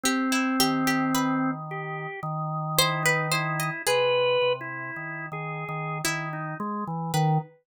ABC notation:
X:1
M:7/8
L:1/16
Q:1/4=55
K:none
V:1 name="Drawbar Organ"
C6 G2 z2 E _E =E2 | (3B4 E4 _A4 E _E _A, =E, _E, z |]
V:2 name="Drawbar Organ" clef=bass
z2 _E,6 E,6 | C,2 C,2 (3_E,2 E,2 E,2 E,2 z4 |]
V:3 name="Harpsichord"
G E G G B4 z2 c B c _e | _A8 E2 z2 B2 |]